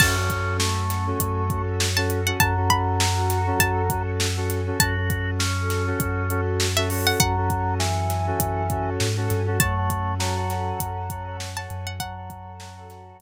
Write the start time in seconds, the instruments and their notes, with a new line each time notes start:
0.00 synth bass 2 F#2, electric piano 2 C#4 F#4 A4, drawbar organ C#4, pad 5 (bowed) C#4 F#4 A4, pizzicato strings A5, kick, crash
0.17 electric piano 2 C#4 F#4 A4
0.30 kick, closed hi-hat
0.59 drawbar organ A3, snare
0.90 snare, closed hi-hat
1.07 electric piano 2 C#4 F#4 A4
1.20 synth bass 2 F#2, kick, closed hi-hat
1.50 electric piano 2 C#4 F#4 A4, kick, closed hi-hat
1.80 snare
1.97 electric piano 2 C#4 F#4 A4, pizzicato strings A5
2.10 closed hi-hat
2.27 electric piano 2 C#4 F#4 A4, pizzicato strings F#5
2.40 synth bass 2 F#2, drawbar organ F#3, pad 5 (bowed) C#4 F#4 A4, electric piano 2 C#4 F#4 A4, pizzicato strings A5, kick, closed hi-hat
2.57 electric piano 2 C#4 F#4 A4
2.70 pizzicato strings B5, kick, closed hi-hat
3.00 snare
3.30 snare, closed hi-hat
3.47 electric piano 2 C#4 F#4 A4
3.60 synth bass 2 F#2, pizzicato strings A5, kick, closed hi-hat
3.90 electric piano 2 C#4 F#4 A4, kick, closed hi-hat
4.20 snare
4.37 electric piano 2 C#4 F#4 A4
4.50 snare, closed hi-hat
4.67 electric piano 2 C#4 F#4 A4
4.79 synth bass 2 F#2, pad 5 (bowed) C#4 F#4 A4, electric piano 2 C#4 F#4 A4, drawbar organ F#4, pizzicato strings A5, kick, closed hi-hat
4.97 electric piano 2 C#4 F#4 A4
5.10 kick, closed hi-hat
5.39 drawbar organ C#4, snare
5.70 snare, closed hi-hat
5.87 electric piano 2 C#4 F#4 A4
6.00 synth bass 2 F#2, kick, closed hi-hat
6.30 electric piano 2 C#4 F#4 A4, closed hi-hat
6.60 snare
6.77 electric piano 2 C#4 F#4 A4, pizzicato strings E5
6.90 electric piano 2 C#4 F#4 A4, open hi-hat
7.07 pizzicato strings F#5
7.20 synth bass 2 F#2, drawbar organ F#3, pad 5 (bowed) C#4 F#4 A4, pizzicato strings F#5, kick, closed hi-hat
7.37 electric piano 2 C#4 F#4 A4
7.50 kick, closed hi-hat
7.79 drawbar organ E3, snare
8.10 snare, closed hi-hat
8.27 electric piano 2 C#4 F#4 A4
8.40 synth bass 2 F#2, kick, closed hi-hat
8.70 electric piano 2 C#4 F#4 A4, kick, closed hi-hat
9.00 synth bass 2 G#2, snare
9.17 electric piano 2 C#4 F#4 A4
9.30 synth bass 2 G2, snare, closed hi-hat
9.47 electric piano 2 C#4 F#4 A4
9.60 synth bass 2 F#2, drawbar organ A3, pad 5 (bowed) C#4 F#4 A4, electric piano 2 C#5 F#5 A5, pizzicato strings A5, kick, closed hi-hat
9.77 electric piano 2 C#5 F#5 A5
9.90 kick, closed hi-hat
10.20 drawbar organ F#3, electric piano 2 C#5 F#5 A5, snare
10.37 electric piano 2 C#5 F#5 A5
10.50 electric piano 2 C#5 F#5 A5, snare, closed hi-hat
10.80 synth bass 2 F#2, kick, closed hi-hat
11.10 electric piano 2 C#5 F#5 A5, kick, closed hi-hat
11.27 electric piano 2 C#5 F#5 A5
11.40 snare
11.57 electric piano 2 C#5 F#5 A5, pizzicato strings A5
11.70 synth bass 2 F#2, closed hi-hat
11.87 pizzicato strings F#5
12.00 drawbar organ F#3, pad 5 (bowed) C#4 F#4 A4, electric piano 2 C#5 F#5 A5, pizzicato strings F#5, kick, closed hi-hat
12.17 electric piano 2 C#5 F#5 A5
12.30 kick, closed hi-hat
12.60 electric piano 2 C#5 F#5 A5, snare
12.77 electric piano 2 C#5 F#5 A5
12.90 electric piano 2 C#5 F#5 A5, snare, closed hi-hat
13.19 synth bass 2 F#2, kick, closed hi-hat